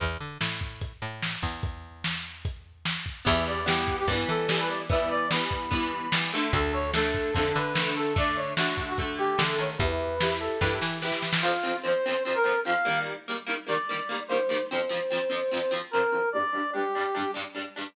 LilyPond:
<<
  \new Staff \with { instrumentName = "Brass Section" } { \time 4/4 \key e \dorian \tempo 4 = 147 r1 | r1 | e''8 d''8 g'8. g'16 r8 a'8. b'16 d''16 r16 | e''8 d''8 b''2 r4 |
a'8 cis''8 a'4 a'8 b'4 a'8 | d''8 cis''8 fis'8. fis'16 r8 g'8. a'16 cis''16 r16 | b'4. a'4 r4. | \key f \dorian f'4 c''4 c''16 bes'8. f''4 |
r4. d''4. c''4 | c''2. bes'4 | d''4 g'4. r4. | }
  \new Staff \with { instrumentName = "Acoustic Guitar (steel)" } { \time 4/4 \key e \dorian r1 | r1 | <e g b>4 <e g b>4 <e g b>4 <e g b>4 | <e g b>4 <e g b>4 <e g b>4 <e g b>8 <d a>8~ |
<d a>4 <d a>4 <d a>4 <d a>4 | <d a>4 <d a>4 <d a>4 <d a>4 | <e' g' b'>4 <e' g' b'>4 <e' g' b'>4 <e' g' b'>4 | \key f \dorian <f, f c'>8 <f, f c'>8 <f, f c'>8 <f, f c'>8 <f, f c'>8 <f, f c'>8 <f, f c'>8 <ees g bes>8~ |
<ees g bes>8 <ees g bes>8 <ees g bes>8 <ees g bes>8 <ees g bes>8 <ees g bes>8 <ees g bes>8 <ees g bes>8 | <f, f c'>8 <f, f c'>8 <f, f c'>8 <f, f c'>8 <f, f c'>8 <f, f c'>8 <f, f c'>8 <f, f c'>8 | <g, g d'>8 <g, g d'>8 <g, g d'>8 <g, g d'>8 <g, g d'>8 <g, g d'>8 <g, g d'>8 <g, g d'>8 | }
  \new Staff \with { instrumentName = "Electric Bass (finger)" } { \clef bass \time 4/4 \key e \dorian e,8 d8 a,4. a,4 e,8~ | e,1 | e,2 g,8 e4.~ | e1 |
d,2 f,8 d4.~ | d2. d8 dis8 | e,2 g,8 e4. | \key f \dorian r1 |
r1 | r1 | r1 | }
  \new DrumStaff \with { instrumentName = "Drums" } \drummode { \time 4/4 <hh bd>4 sn8 bd8 <hh bd>4 sn8 bd8 | <hh bd>4 sn4 <hh bd>4 sn8 bd8 | <hh bd>8 hh8 sn8 <hh bd>8 <hh bd>8 hh8 sn8 hh8 | <hh bd>8 hh8 sn8 <hh bd>8 <hh bd>8 hh8 sn8 hh8 |
<hh bd>8 hh8 sn8 <hh bd>8 <hh bd>8 hh8 sn8 hh8 | <hh bd>8 hh8 sn8 <hh bd>8 <hh bd>8 hh8 sn8 hh8 | <hh bd>8 hh8 sn8 hh8 <bd sn>8 sn8 sn16 sn16 sn16 sn16 | r4 r4 r4 r4 |
r4 r4 r4 r4 | r4 r4 r4 r4 | r4 r4 r4 r4 | }
>>